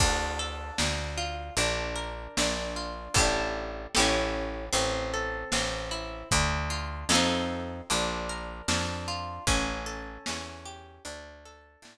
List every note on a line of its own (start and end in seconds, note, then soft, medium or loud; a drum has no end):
0.00 0.71 D2 medium
0.00 0.78 D4 loud
0.00 kick loud
0.00 crash medium
0.39 1.52 A4 medium
0.78 1.50 D2 medium
0.78 1.53 D4 medium
0.78 snare loud
1.18 1.55 F4 medium
1.57 2.28 A#1 medium
1.57 2.38 D4 loud
1.57 closed hi-hat medium
1.96 3.08 A#4 medium
2.37 3.09 A#1 medium
2.37 3.13 D4 medium
2.37 snare loud
2.76 3.14 F4 medium
3.14 3.87 A1 loud
3.14 3.86 E4 medium
3.14 3.86 G4 medium
3.14 3.86 A4 loud
3.14 kick medium
3.14 closed hi-hat medium
3.20 3.86 D4 loud
3.95 4.69 A1 medium
3.95 4.66 E4 loud
3.95 4.66 G4 loud
3.95 4.66 A4 loud
3.95 snare loud
4.00 4.66 C#4 medium
4.73 5.44 A1 medium
4.73 5.52 C4 loud
4.73 closed hi-hat medium
5.14 6.26 A4 medium
5.52 6.24 A1 medium
5.52 6.28 C4 medium
5.52 snare loud
5.91 6.29 E4 medium
6.31 7.05 D2 loud
6.31 7.07 D4 medium
6.31 kick medium
6.31 closed hi-hat loud
6.70 7.08 F4 medium
7.09 7.82 F2 loud
7.09 7.81 F4 medium
7.09 7.81 A4 medium
7.09 snare loud
7.13 7.81 C4 loud
7.13 7.81 D#4 loud
7.90 8.62 A#1 medium
7.90 8.68 D4 loud
7.90 closed hi-hat medium
8.29 9.42 A#4 medium
8.68 9.39 F2 medium
8.68 9.44 D4 medium
8.68 snare loud
9.08 9.45 F4 medium
9.47 10.18 A1 medium
9.47 10.26 C#4 loud
9.47 kick medium
9.47 closed hi-hat medium
9.86 10.99 A4 medium
10.26 10.99 E2 medium
10.26 11.02 C#4 medium
10.26 snare loud
10.65 11.03 G4 medium
11.05 11.77 D2 medium
11.05 11.82 D4 medium
11.05 closed hi-hat medium
11.45 11.98 A4 medium
11.82 11.98 A2 medium
11.82 11.98 D4 medium
11.82 snare loud